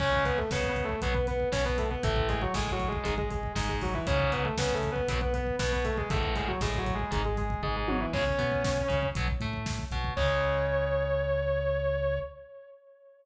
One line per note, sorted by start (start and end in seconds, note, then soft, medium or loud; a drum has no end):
0.00 0.43 C#2 medium
0.00 0.39 C#3 loud
0.00 0.39 G#3 loud
0.00 0.24 C#4 medium
0.00 0.24 C#5 medium
0.00 kick loud
0.00 crash loud
0.13 kick loud
0.25 0.37 B3 medium
0.25 0.37 B4 medium
0.25 kick loud
0.25 closed hi-hat medium
0.38 0.50 A3 medium
0.38 0.50 A4 medium
0.38 kick medium
0.51 0.94 C#2 medium
0.51 0.96 C#3 medium
0.51 0.67 B3 medium
0.51 0.67 B4 medium
0.51 kick loud
0.51 snare loud
0.64 kick loud
0.68 0.84 B3 medium
0.68 0.84 B4 medium
0.76 kick medium
0.76 closed hi-hat medium
0.84 1.00 A3 medium
0.84 1.00 A4 medium
0.89 kick medium
1.02 1.45 B1 medium
1.02 1.13 B2 loud
1.02 1.13 F#3 loud
1.02 1.14 B3 medium
1.02 1.14 B4 medium
1.02 kick loud
1.02 closed hi-hat loud
1.14 1.26 B3 medium
1.14 1.26 B4 medium
1.14 kick loud
1.27 1.49 B3 medium
1.27 1.49 B4 medium
1.27 kick medium
1.27 closed hi-hat medium
1.40 kick medium
1.52 1.96 B1 medium
1.52 1.95 B2 medium
1.52 1.64 C#4 medium
1.52 1.64 C#5 medium
1.52 kick loud
1.52 snare loud
1.65 1.77 B3 medium
1.65 1.77 B4 medium
1.65 kick loud
1.78 1.90 A3 medium
1.78 1.90 A4 medium
1.78 kick medium
1.78 closed hi-hat loud
1.90 2.02 B3 medium
1.90 2.02 B4 medium
1.90 kick medium
2.03 2.47 A1 medium
2.03 2.44 A2 loud
2.03 2.44 E3 loud
2.03 2.28 A3 medium
2.03 2.28 A4 medium
2.03 kick loud
2.03 closed hi-hat loud
2.16 kick loud
2.28 2.41 G#3 medium
2.28 2.41 G#4 medium
2.28 kick medium
2.28 closed hi-hat medium
2.42 2.54 F#3 medium
2.42 2.54 F#4 medium
2.42 kick medium
2.54 2.98 A1 medium
2.54 2.99 A2 medium
2.54 2.71 G#3 medium
2.54 2.71 G#4 medium
2.54 kick medium
2.54 snare loud
2.67 kick loud
2.72 2.88 F#3 medium
2.72 2.88 F#4 medium
2.80 kick medium
2.80 closed hi-hat medium
2.88 3.04 G#3 medium
2.88 3.04 G#4 medium
2.92 kick loud
3.03 3.48 G#1 medium
3.03 3.14 G#2 loud
3.03 3.14 D#3 loud
3.03 3.17 G#3 medium
3.03 3.17 G#4 medium
3.03 kick loud
3.03 closed hi-hat loud
3.18 3.30 G#3 medium
3.18 3.30 G#4 medium
3.18 kick loud
3.31 3.52 G#3 medium
3.31 3.52 G#4 medium
3.31 kick loud
3.31 closed hi-hat medium
3.43 kick medium
3.55 3.99 G#1 medium
3.55 3.99 G#2 medium
3.55 3.68 G#3 medium
3.55 3.68 G#4 medium
3.55 kick loud
3.55 snare loud
3.69 3.81 G#3 medium
3.69 3.81 G#4 medium
3.69 kick loud
3.81 3.94 F#3 medium
3.81 3.94 F#4 medium
3.81 kick loud
3.81 open hi-hat medium
3.94 4.06 E3 medium
3.94 4.06 E4 medium
3.94 kick loud
4.07 4.50 C#2 medium
4.07 4.47 G#2 loud
4.07 4.47 C#3 loud
4.07 4.31 C#4 medium
4.07 4.31 C#5 medium
4.07 kick loud
4.07 closed hi-hat loud
4.19 kick loud
4.32 4.44 B3 medium
4.32 4.44 B4 medium
4.32 kick medium
4.32 closed hi-hat medium
4.44 4.56 A3 medium
4.44 4.56 A4 medium
4.44 kick medium
4.58 5.01 C#2 medium
4.58 5.01 C#3 medium
4.58 4.74 B3 medium
4.58 4.74 B4 medium
4.58 kick loud
4.58 snare loud
4.70 4.90 A3 medium
4.70 4.90 A4 medium
4.70 kick medium
4.83 kick loud
4.83 closed hi-hat medium
4.92 5.08 B3 medium
4.92 5.08 B4 medium
4.96 kick loud
5.08 5.51 B1 medium
5.08 5.19 F#2 loud
5.08 5.19 B2 loud
5.08 5.20 B3 medium
5.08 5.20 B4 medium
5.08 kick loud
5.08 closed hi-hat loud
5.21 5.33 B3 medium
5.21 5.33 B4 medium
5.21 kick loud
5.34 5.56 B3 medium
5.34 5.56 B4 medium
5.34 kick medium
5.34 closed hi-hat medium
5.47 kick medium
5.59 6.03 B1 medium
5.59 6.03 B2 medium
5.59 5.71 B3 medium
5.59 5.71 B4 medium
5.59 kick loud
5.59 snare loud
5.72 5.84 B3 medium
5.72 5.84 B4 medium
5.72 kick medium
5.84 5.97 A3 medium
5.84 5.97 A4 medium
5.84 kick medium
5.84 closed hi-hat medium
5.97 6.09 G#3 medium
5.97 6.09 G#4 medium
5.97 kick loud
6.10 6.54 A1 medium
6.10 6.51 E2 loud
6.10 6.51 A2 loud
6.10 6.34 A3 medium
6.10 6.34 A4 medium
6.10 kick loud
6.10 closed hi-hat loud
6.23 kick loud
6.35 6.47 G#3 medium
6.35 6.47 G#4 medium
6.35 kick loud
6.35 closed hi-hat medium
6.48 6.60 F#3 medium
6.48 6.60 F#4 medium
6.48 kick medium
6.61 7.04 A1 medium
6.61 7.05 A2 medium
6.61 6.78 G#3 medium
6.61 6.78 G#4 medium
6.61 kick loud
6.61 snare loud
6.74 kick loud
6.78 6.94 F#3 medium
6.78 6.94 F#4 medium
6.86 kick loud
6.86 closed hi-hat medium
6.94 7.10 G#3 medium
6.94 7.10 G#4 medium
6.99 kick medium
7.11 7.55 G#1 medium
7.11 7.21 G#2 loud
7.11 7.21 D#3 loud
7.11 7.24 G#3 medium
7.11 7.24 G#4 medium
7.11 kick loud
7.11 closed hi-hat loud
7.25 7.37 G#3 medium
7.25 7.37 G#4 medium
7.25 kick medium
7.37 7.62 G#3 medium
7.37 7.62 G#4 medium
7.37 kick medium
7.37 closed hi-hat medium
7.50 kick loud
7.63 8.06 G#1 medium
7.63 8.06 G#2 medium
7.63 7.75 G#3 medium
7.63 7.75 G#4 medium
7.63 kick medium
7.63 floor tom medium
7.76 7.88 G#3 medium
7.76 7.88 G#4 medium
7.88 8.00 F#3 medium
7.88 8.00 F#4 medium
7.88 high tom loud
8.00 8.12 E3 medium
8.00 8.12 E4 medium
8.13 8.35 C#2 medium
8.13 8.23 C#3 loud
8.13 8.23 G#3 loud
8.13 9.07 C#4 medium
8.13 9.07 C#5 medium
8.13 kick loud
8.13 crash loud
8.26 kick loud
8.38 8.82 B2 medium
8.38 8.82 B3 medium
8.38 kick loud
8.38 closed hi-hat medium
8.52 kick loud
8.64 kick loud
8.64 snare loud
8.77 kick medium
8.88 9.12 C#2 medium
8.88 9.10 C#3 medium
8.88 kick loud
8.88 closed hi-hat medium
9.03 kick loud
9.15 9.37 B1 medium
9.15 9.27 B2 loud
9.15 9.27 F#3 loud
9.15 kick loud
9.15 closed hi-hat loud
9.28 kick loud
9.40 9.83 A2 medium
9.40 9.85 A3 medium
9.40 kick medium
9.40 closed hi-hat medium
9.53 kick medium
9.66 kick loud
9.66 snare loud
9.79 kick loud
9.91 10.13 B1 medium
9.91 10.14 B2 medium
9.91 kick loud
9.91 closed hi-hat medium
10.04 kick loud
10.16 12.19 C#2 loud
10.16 12.19 C#3 medium
10.16 12.19 G#3 loud
10.16 12.19 C#5 loud
10.16 kick loud
10.16 crash loud